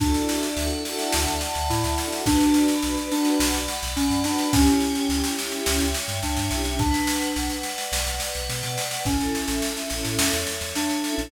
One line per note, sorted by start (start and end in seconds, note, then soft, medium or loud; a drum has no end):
0.00 0.13 D2 loud
0.00 0.83 D4 loud
0.00 0.46 F#4 loud
0.00 0.46 A4 loud
0.00 1.13 D5 loud
0.00 kick loud
0.00 snare medium
0.05 0.46 D4 medium
0.05 0.46 E4 medium
0.14 snare medium
0.29 1.41 E5 medium
0.29 snare medium
0.43 snare medium
0.57 0.69 D2 loud
0.57 0.68 F#4 medium
0.57 0.68 A4 medium
0.57 1.70 F#5 medium
0.57 snare medium
0.62 0.68 D4 medium
0.62 0.68 E4 medium
0.72 0.83 F#4 medium
0.72 0.83 A4 medium
0.77 0.83 D4 medium
0.77 0.83 E4 medium
0.85 1.30 F#4 medium
0.85 1.30 A4 medium
0.85 1.98 A5 loud
0.85 snare medium
0.90 1.30 D4 medium
0.90 1.30 E4 medium
0.99 snare medium
1.12 1.26 D2 loud
1.12 2.21 D5 medium
1.12 snare loud
1.27 1.40 D2 medium
1.27 snare medium
1.41 2.22 E5 medium
1.41 snare medium
1.55 1.68 D2 medium
1.55 snare medium
1.70 1.83 A2 loud
1.70 2.22 E4 medium
1.70 2.24 F#5 medium
1.70 snare medium
1.83 1.96 D2 loud
1.83 snare medium
1.97 2.09 F#4 medium
1.97 2.09 A4 medium
1.97 2.25 A5 medium
1.97 snare medium
2.02 2.09 D4 medium
2.02 2.09 E4 medium
2.12 2.24 F#4 medium
2.12 2.24 A4 medium
2.12 snare medium
2.18 2.24 D4 medium
2.18 2.24 E4 medium
2.26 2.39 B1 loud
2.26 2.99 D4 loud
2.26 2.72 F#4 loud
2.26 2.72 B4 medium
2.26 2.83 D5 loud
2.26 kick loud
2.26 snare medium
2.31 2.72 D4 loud
2.40 snare medium
2.54 3.68 B5 medium
2.54 snare medium
2.68 snare medium
2.82 2.96 B1 medium
2.82 2.93 F#4 medium
2.82 2.93 B4 medium
2.82 3.39 D5 medium
2.82 snare medium
2.87 2.93 D4 medium
2.97 3.08 F#4 medium
2.97 3.08 B4 medium
2.97 snare medium
3.02 3.08 D4 medium
3.11 3.58 D4 medium
3.11 3.58 F#4 medium
3.11 3.58 B4 medium
3.11 3.96 F#5 medium
3.11 snare medium
3.18 3.58 D4 medium
3.25 snare medium
3.40 3.52 B1 loud
3.40 4.25 D5 loud
3.40 snare loud
3.54 3.67 B1 medium
3.54 snare medium
3.68 4.49 B5 medium
3.68 snare medium
3.82 3.95 B1 loud
3.82 snare medium
3.96 4.09 B1 loud
3.96 4.21 C#4 medium
3.96 4.51 F#5 medium
3.96 snare medium
4.10 4.23 F#2 loud
4.10 snare medium
4.24 4.51 D4 medium
4.24 4.36 F#4 medium
4.24 4.36 B4 medium
4.24 4.53 D5 medium
4.24 snare medium
4.30 4.36 D4 medium
4.38 4.49 F#4 medium
4.38 4.49 B4 medium
4.38 snare medium
4.43 4.49 D4 medium
4.52 4.66 C#2 loud
4.52 5.31 C#4 loud
4.52 4.98 E4 medium
4.52 4.98 G4 loud
4.52 5.08 C#5 loud
4.52 kick loud
4.52 snare loud
4.58 4.98 C#4 medium
4.66 snare medium
4.80 5.95 G5 medium
4.80 snare medium
4.95 snare medium
5.08 5.22 C#2 medium
5.08 5.20 E4 medium
5.08 5.20 G4 medium
5.08 5.66 C#5 loud
5.08 snare medium
5.14 5.20 C#4 medium
5.24 5.36 E4 medium
5.24 5.36 G4 medium
5.24 snare medium
5.29 5.36 C#4 medium
5.37 5.84 G4 medium
5.37 6.22 E5 medium
5.37 snare medium
5.42 5.84 C#4 medium
5.42 5.84 E4 medium
5.52 snare medium
5.66 5.79 C#2 loud
5.66 6.49 C#5 loud
5.66 snare loud
5.80 5.93 C#2 loud
5.80 snare medium
5.94 6.76 G5 medium
5.94 snare medium
6.08 6.21 G2 medium
6.08 snare medium
6.22 6.36 C#2 loud
6.22 6.70 D4 medium
6.22 6.76 E5 medium
6.22 snare medium
6.37 6.50 G2 loud
6.37 snare medium
6.49 6.92 B1 loud
6.49 6.62 E4 medium
6.49 6.62 G4 medium
6.49 6.76 C#5 medium
6.49 snare medium
6.55 6.62 C#4 medium
6.65 6.77 E4 medium
6.65 6.77 G4 medium
6.65 snare medium
6.71 6.77 C#4 medium
6.79 7.55 D4 loud
6.79 7.35 B4 loud
6.79 kick loud
6.79 snare medium
6.94 snare medium
7.07 8.21 F#5 medium
7.07 snare medium
7.21 snare medium
7.36 7.49 B1 loud
7.36 7.91 B4 loud
7.36 snare medium
7.50 snare medium
7.63 8.48 D5 medium
7.63 snare medium
7.78 snare medium
7.91 8.05 B1 loud
7.91 8.78 B4 medium
7.91 snare loud
8.07 8.19 B1 medium
8.07 snare medium
8.20 9.02 F#5 medium
8.20 snare medium
8.35 8.48 B1 medium
8.35 snare medium
8.49 8.62 B2 medium
8.49 9.03 D5 loud
8.49 snare medium
8.63 8.76 B2 loud
8.63 snare medium
8.78 9.05 B4 medium
8.78 snare medium
8.91 snare medium
9.04 9.18 A1 loud
9.04 9.80 C#4 medium
9.04 9.50 E4 medium
9.04 9.50 A4 medium
9.04 9.63 A4 loud
9.04 kick medium
9.04 snare medium
9.09 9.50 C#4 medium
9.20 9.33 A1 medium
9.20 snare medium
9.35 10.47 E5 loud
9.35 snare medium
9.48 9.61 A1 medium
9.48 snare medium
9.62 9.74 E4 medium
9.62 9.74 A4 medium
9.62 10.18 A4 medium
9.62 snare medium
9.67 9.74 C#4 medium
9.77 9.88 E4 medium
9.77 9.88 A4 medium
9.77 snare medium
9.82 9.88 C#4 medium
9.90 10.04 A1 medium
9.90 10.36 E4 medium
9.90 10.36 A4 medium
9.90 10.75 C#5 medium
9.90 snare medium
9.96 10.36 C#4 medium
10.05 10.17 A2 medium
10.05 snare medium
10.19 10.31 E2 loud
10.19 11.05 A4 medium
10.19 snare loud
10.33 10.46 E2 medium
10.33 snare medium
10.47 11.28 E5 medium
10.47 snare medium
10.61 10.74 E2 medium
10.61 snare medium
10.75 11.26 D4 medium
10.75 11.30 C#5 medium
10.75 snare medium
10.89 snare medium
11.04 11.16 E4 medium
11.04 11.16 A4 medium
11.04 11.31 A4 loud
11.04 snare medium
11.10 11.16 C#4 medium
11.16 11.31 A1 loud
11.16 11.28 E4 medium
11.16 11.28 A4 medium
11.16 snare medium
11.21 11.28 C#4 medium